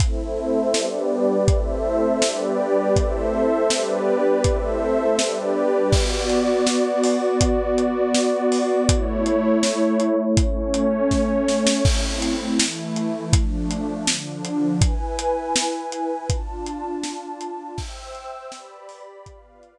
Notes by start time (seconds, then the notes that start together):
0.00 A3 C4 E4 A4 C5 E5, kick, closed hi-hat
0.74 G3 B3 D4 G4 B4 D5, snare
1.48 A3 C4 E4 A4 C5 E5, kick, closed hi-hat
2.21 G3 B3 D4 G4 B4 D5, snare
2.96 A3 C4 E4 A4 C5 E5, kick, closed hi-hat
3.70 G3 B3 D4 G4 B4 D5, snare
4.44 A3 C4 E4 A4 C5 E5, kick, closed hi-hat
5.18 G3 B3 D4 G4 B4 D5, snare
5.92 B3 F#4 D5, kick, crash
6.29 closed hi-hat
6.67 snare
7.04 open hi-hat
7.41 kick, closed hi-hat
7.78 closed hi-hat
8.15 snare
8.52 open hi-hat
8.89 A3 E4 C#5, kick, closed hi-hat
9.26 closed hi-hat
9.63 snare
10.00 closed hi-hat
10.36 A3 C#4 C#5, kick, closed hi-hat
10.74 closed hi-hat
11.11 kick, snare
11.48 snare
11.67 snare
11.85 A3 C4 E4, kick, crash
12.22 closed hi-hat
12.59 E3 A3 E4, snare
12.96 closed hi-hat
13.33 F3 A3 D4, kick, closed hi-hat
13.71 closed hi-hat
14.07 D3 F3 D4, snare
14.45 closed hi-hat
14.81 E4 B4 G#5, kick, closed hi-hat
15.19 closed hi-hat
15.56 snare
15.92 closed hi-hat
16.30 D4 F4 A5, kick, closed hi-hat
16.66 closed hi-hat
17.04 snare
17.41 closed hi-hat
17.78 C5 E5 G5 E6, kick, crash
18.15 closed hi-hat
18.52 G4 B4 D5 B5, snare
18.89 open hi-hat
19.25 B3 F4 B4 D5 F5, kick, closed hi-hat
19.63 closed hi-hat